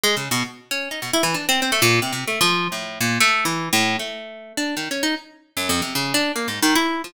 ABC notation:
X:1
M:6/4
L:1/16
Q:1/4=152
K:none
V:1 name="Orchestral Harp"
(3^G,2 ^C,2 B,,2 z3 ^C2 ^D B,, E (3E,2 =D2 =C2 C A, ^A,,2 (3=C,2 C,2 =A,2 | F,3 A,,3 ^A,,2 (3=A,4 E,4 =A,,4 A,6 D2 | (3^D,2 ^C2 ^D2 z4 (3^F,,2 =F,,2 =C,2 ^C,2 =D2 (3^A,2 ^G,,2 ^D,2 E3 F, |]